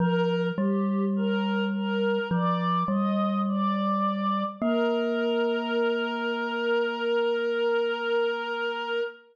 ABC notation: X:1
M:4/4
L:1/8
Q:1/4=52
K:Bb
V:1 name="Choir Aahs"
B G B B d e d2 | B8 |]
V:2 name="Glockenspiel"
F, G,3 F, G,3 | B,8 |]